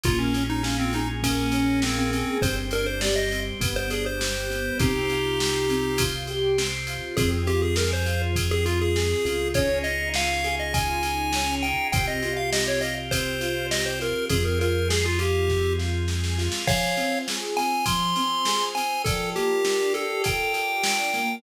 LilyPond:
<<
  \new Staff \with { instrumentName = "Lead 1 (square)" } { \time 4/4 \key f \minor \tempo 4 = 101 f'16 des'8 ees'16 des'16 c'16 ees'16 r16 des'4 c'16 c'16 c'8 | c''16 r16 bes'16 c''16 d''16 ees''8 r8 c''16 aes'16 c''4~ c''16 | <ees' g'>2~ <ees' g'>8 r4. | aes'16 r16 g'16 aes'16 bes'16 c''8 r8 aes'16 f'16 aes'4~ aes'16 |
des''8 ees''8 f''8. ees''16 aes''4. g''8 | g''16 ees''8 f''16 ees''16 des''16 ees''16 r16 c''4 ees''16 c''16 bes'8 | aes'16 bes'16 bes'8 aes'16 f'16 g'4 r4. | <des'' f''>4 r8 aes''8 c'''4. aes''8 |
a'8 g'4 a'8 g''2 | }
  \new Staff \with { instrumentName = "Acoustic Grand Piano" } { \time 4/4 \key f \minor bes8 des'8 f'8 aes'8 bes8 des'8 f'8 aes'8 | c'8 d'8 g'8 c'8 b8 d'8 g'8 b8 | c'8 f'8 g'8 c'8 f'8 g'8 c'8 f'8 | c'8 f'8 aes'8 f'8 c'8 f'8 aes'8 f'8 |
des'8 ees'8 f'8 aes'8 f'8 ees'8 des'8 ees'8 | c'8 f'8 g'8 f'8 c'8 f'8 g'8 f'8 | c'8 f'8 aes'8 f'8 c'8 f'8 aes'8 f'8 | f8 c'8 aes'8 c'8 f8 c'8 aes'8 c'8 |
f8 bes8 d'8 g'8 a'8 g'8 d'8 bes8 | }
  \new Staff \with { instrumentName = "Synth Bass 1" } { \clef bass \time 4/4 \key f \minor bes,,1 | g,,2 g,,2 | c,1 | f,2.~ f,8 des,8~ |
des,1 | c,1 | f,1 | r1 |
r1 | }
  \new Staff \with { instrumentName = "Drawbar Organ" } { \time 4/4 \key f \minor <bes des' f' aes'>2 <bes des' aes' bes'>2 | <c' d' g'>4 <g c' g'>4 <b d' g'>4 <g b g'>4 | <c' f' g'>2 <c' g' c''>2 | <c' f' aes'>1 |
<des' ees' f' aes'>1 | <c' f' g'>1 | <c' f' aes'>1 | <f' c'' aes''>1 |
<f' bes' d'' g'' a''>1 | }
  \new DrumStaff \with { instrumentName = "Drums" } \drummode { \time 4/4 <bd cymr>8 cymr8 sn8 cymr8 <bd cymr>8 cymr8 sn8 cymr8 | <bd cymr>8 cymr8 sn8 cymr8 <bd cymr>8 cymr8 sn8 cymr8 | <bd cymr>8 cymr8 sn8 cymr8 <bd cymr>8 cymr8 sn8 cymr8 | <bd cymr>8 cymr8 sn8 cymr8 <bd cymr>8 cymr8 sn8 cymr8 |
<bd cymr>8 cymr8 sn8 cymr8 <bd cymr>8 cymr8 sn8 cymr8 | <bd cymr>8 cymr8 sn8 cymr8 <bd cymr>8 cymr8 sn8 cymr8 | <bd cymr>8 cymr8 sn8 cymr8 <bd sn>8 sn8 sn16 sn16 sn16 sn16 | <cymc bd>8 cymr8 sn8 cymr8 <bd cymr>8 cymr8 sn8 cymr8 |
<bd cymr>8 cymr8 sn8 cymr8 <bd cymr>8 cymr8 sn8 cymr8 | }
>>